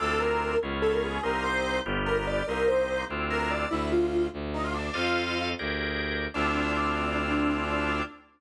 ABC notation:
X:1
M:6/8
L:1/16
Q:3/8=97
K:Dphr
V:1 name="Lead 1 (square)"
A2 B4 z2 A B _A2 | B2 c4 z2 B B d2 | B2 c4 z2 B B d2 | =E2 F4 z2 _E F D2 |
"^rit." F6 z6 | D12 |]
V:2 name="Drawbar Organ"
[CD=EF]6 [_C_DF_A]6 | [B,CEG]6 [=B,DFG]6 | [B,CEG]6 [CD=EF]6 | z12 |
"^rit." [Acef]6 [G_ABd]6 | [CD=EF]12 |]
V:3 name="Violin" clef=bass
D,,6 _D,,6 | C,,6 G,,,6 | C,,6 D,,6 | D,,6 D,,6 |
"^rit." F,,6 D,,6 | D,,12 |]